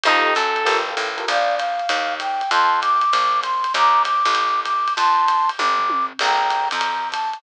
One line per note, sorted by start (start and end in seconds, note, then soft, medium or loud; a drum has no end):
0.04 0.34 F2 loud
0.04 0.30 D#4 loud
0.04 0.34 D#4 loud
0.04 0.30 F4 loud
0.04 0.30 G4 loud
0.04 0.30 A4 loud
0.04 ride loud
0.35 0.65 F#2 loud
0.35 0.77 A4 loud
0.35 hi-hat pedal loud
0.35 ride medium
0.56 ride medium
0.65 0.95 G1 loud
0.65 0.80 F4 loud
0.65 0.80 G4 loud
0.65 0.80 A4 loud
0.65 0.80 A#4 loud
0.65 ride loud
0.88 1.07 F4 medium
0.88 1.07 G4 medium
0.88 1.07 A4 loud
0.88 1.07 A#4 medium
0.97 1.26 A1 medium
0.97 hi-hat pedal medium
0.97 ride medium
1.17 1.24 F4 loud
1.17 1.24 G4 medium
1.17 1.24 A4 loud
1.17 1.24 A#4 loud
1.17 ride medium
1.28 1.82 A#1 loud
1.28 1.59 D5 loud
1.28 1.55 F5 loud
1.28 kick medium
1.28 ride loud
1.56 2.14 F5 loud
1.56 hi-hat pedal loud
1.56 ride loud
1.79 ride medium
1.89 2.43 D#2 loud
1.89 ride loud
2.20 2.50 G5 loud
2.20 hi-hat pedal loud
2.20 ride loud
2.41 ride medium
2.51 3.05 F2 loud
2.51 2.80 A5 loud
2.51 2.80 C6 loud
2.51 kick medium
2.51 ride loud
2.82 3.40 D6 loud
2.82 hi-hat pedal medium
2.82 ride loud
3.01 ride medium
3.12 3.66 A#1 medium
3.12 kick medium
3.12 ride loud
3.43 3.73 C6 medium
3.43 hi-hat pedal medium
3.43 ride loud
3.64 ride medium
3.73 4.23 D#2 loud
3.73 4.02 A#5 loud
3.73 4.02 D6 loud
3.73 kick medium
3.73 ride loud
4.04 4.61 D6 medium
4.04 hi-hat pedal medium
4.04 ride loud
4.25 4.89 A1 loud
4.25 ride medium
4.35 ride loud
4.64 4.93 D6 medium
4.64 kick medium
4.64 hi-hat pedal loud
4.64 ride loud
4.88 ride medium
4.96 5.51 F2 medium
4.96 5.50 A5 loud
4.96 5.50 C6 loud
4.96 kick medium
4.96 ride loud
5.28 hi-hat pedal loud
5.28 ride loud
5.49 ride medium
5.58 6.13 G1 loud
5.58 6.06 D6 medium
5.58 kick medium
5.58 high tom medium
5.79 floor tom loud
5.90 high tom loud
6.19 6.69 A#1 loud
6.19 6.68 G5 medium
6.19 6.68 A#5 loud
6.19 crash loud
6.19 ride loud
6.50 hi-hat pedal medium
6.50 ride loud
6.71 7.36 F2 medium
6.71 7.09 A#5 medium
6.71 ride loud
6.81 ride loud
7.11 7.38 A5 medium
7.11 kick medium
7.11 hi-hat pedal loud
7.11 ride loud
7.33 ride medium